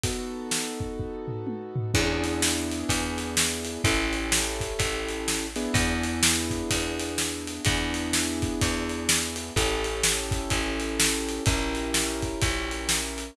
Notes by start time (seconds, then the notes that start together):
0.04 B3 D#4 F#4 A4, kick, closed hi-hat
0.51 snare
0.80 kick
1.00 kick
1.28 floor tom
1.47 high tom
1.76 floor tom
1.94 E2 B3 D4 E4 G#4, kick, crash
2.24 closed hi-hat
2.42 snare
2.72 closed hi-hat
2.89 E2, kick, closed hi-hat
3.18 closed hi-hat
3.37 snare
3.65 closed hi-hat
3.84 A1 C#4 E4 G4 A4, kick, closed hi-hat
4.13 closed hi-hat
4.32 snare
4.60 kick, closed hi-hat
4.79 A1, kick, closed hi-hat
5.09 closed hi-hat
5.28 snare
5.56 B3 D4 E4 G#4, closed hi-hat
5.74 E2, kick, closed hi-hat
6.03 closed hi-hat
6.23 snare
6.51 kick, closed hi-hat
6.71 E2, kick, closed hi-hat
7.00 closed hi-hat
7.18 snare
7.47 closed hi-hat
7.65 E2 B3 D4 E4 G#4, kick, closed hi-hat
7.94 closed hi-hat
8.13 snare
8.42 kick, closed hi-hat
8.62 E2, kick, closed hi-hat
8.89 closed hi-hat
9.09 snare
9.36 closed hi-hat
9.56 A1 C#4 E4 G4 A4, kick, closed hi-hat
9.84 closed hi-hat
10.03 snare
10.31 kick, closed hi-hat
10.50 A1, kick, closed hi-hat
10.80 closed hi-hat
11.00 snare
11.29 closed hi-hat
11.46 A#1 C#4 E4 G4 A#4, kick, closed hi-hat
11.75 closed hi-hat
11.94 snare
12.23 kick, closed hi-hat
12.42 A#1, kick, closed hi-hat
12.71 closed hi-hat
12.89 snare
13.18 closed hi-hat